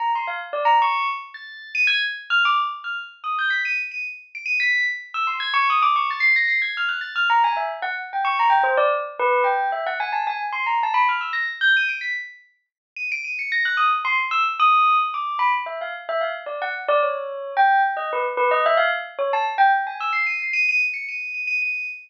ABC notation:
X:1
M:9/8
L:1/16
Q:3/8=74
K:none
V:1 name="Tubular Bells"
_b c' f z d b _d'2 z2 a'3 _e'' _a' z2 f' | d' z2 f' z2 _e' g' b' _e'' z e'' z2 d'' e'' b'2 | z2 e' c' _a' _d' _e' =d' _d' =a' c'' _b' c'' _a' f' _g' =a' f' | _b _a e z _g z =g _d' b g c =d z2 =B2 g2 |
e _g _a =a _a z c' _b =a =b f' e' _b' z =g' _e'' d'' =b' | z6 _e'' d'' e'' _d'' _b' _g' _e' z c' z =e' z | _e'3 z d'2 b z =e f z e f z d _g z d | _d4 g2 z _e B z B e =e f z2 d a |
z g z _a e' c'' _e'' c'' e'' e'' z _d'' e''2 e'' e'' e''2 |]